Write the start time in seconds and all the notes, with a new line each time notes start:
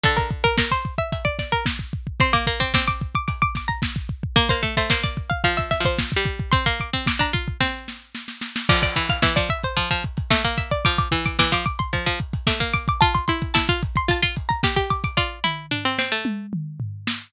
0.03 D3 A4, kick, closed hi-hat
0.17 A#4, kick
0.31 kick
0.44 A#4, kick
0.58 A#4, kick, snare
0.71 C5, kick
0.85 kick
0.98 E5, kick
1.12 E5, kick, closed hi-hat
1.25 D5, kick
1.39 D5, kick, snare
1.52 A#4, kick
1.66 kick, snare
1.79 kick
1.93 kick
2.07 kick
2.20 C4 C6, kick, closed hi-hat
2.33 A#3 D6, kick
2.47 A#3, kick
2.60 C4 D6, kick
2.74 C4 D6, kick, snare
2.88 D6, kick
3.01 kick
3.15 D6, kick
3.28 D6, kick, closed hi-hat
3.42 D6, kick
3.55 D6, kick, snare
3.68 A#5, kick
3.82 kick, snare
3.96 kick
4.09 kick
4.23 kick
4.36 A#3 A#4, kick, closed hi-hat
4.49 A#3 C5, kick
4.63 A3, kick
4.77 A3 C5, kick
4.90 A#3 C5, kick, snare
5.03 D5, kick
5.17 kick
5.30 F5, kick
5.44 F3 F5, kick, closed hi-hat
5.57 E5, kick
5.71 E5, kick, snare
5.80 F3
5.85 C5, kick
5.99 kick, snare
6.12 kick
6.16 G3
6.25 kick
6.40 kick
6.52 C4 C6, kick, closed hi-hat
6.66 A#3, kick
6.80 D6, kick
6.93 C4, kick
7.06 D6, kick, snare
7.19 D4 A#5, kick
7.33 F4, kick
7.48 kick
7.60 C4, kick, snare
7.88 snare
8.15 snare
8.28 snare
8.41 snare
8.56 snare
8.69 F3 D5, kick, crash
8.82 D5, kick, closed hi-hat
8.96 E3, kick, closed hi-hat
9.09 F5, kick, closed hi-hat
9.22 E3 E5, kick, snare
9.36 F3 D5, kick, closed hi-hat
9.49 E5, kick, closed hi-hat
9.63 C5, kick, closed hi-hat
9.77 F3, kick, closed hi-hat
9.91 F3, kick, closed hi-hat
10.04 kick, closed hi-hat
10.17 kick, closed hi-hat
10.31 A3 E5, kick, snare
10.44 A#3, kick, closed hi-hat
10.58 E5, kick, closed hi-hat
10.71 D5, kick, closed hi-hat
10.85 F3 D6, kick, closed hi-hat
10.98 D6, kick, closed hi-hat
11.11 E3, kick, closed hi-hat
11.26 D6, kick, closed hi-hat
11.39 E3 D6, kick, snare
11.52 F3 D6, kick, closed hi-hat
11.66 D6, kick, closed hi-hat
11.79 C6, kick, closed hi-hat
11.93 F3, kick, closed hi-hat
12.06 F3, kick, closed hi-hat
12.20 kick, closed hi-hat
12.33 kick, closed hi-hat
12.47 A3 D6, kick, snare
12.60 A#3, kick, closed hi-hat
12.74 D6, kick, closed hi-hat
12.88 D6, kick, closed hi-hat
13.01 F4 A5, kick, closed hi-hat
13.15 C6, kick, closed hi-hat
13.28 E4 C6, kick, closed hi-hat
13.42 kick, closed hi-hat
13.54 E4 A5, kick, snare
13.69 F4, kick, closed hi-hat
13.82 kick, closed hi-hat
13.96 C6, kick, closed hi-hat
14.08 F4 A5, kick, closed hi-hat
14.22 F4 C6, kick, closed hi-hat
14.36 kick, closed hi-hat
14.49 A#5, kick, closed hi-hat
14.63 G4, kick, snare
14.76 G4, kick, closed hi-hat
14.90 D6, kick, closed hi-hat
15.04 D6, kick, closed hi-hat
15.17 F4 D5, kick
15.44 E4, mid tom
15.71 D4, floor tom
15.85 C4
15.98 C4, snare
16.12 A3
16.25 high tom
16.53 mid tom
16.80 floor tom
17.07 snare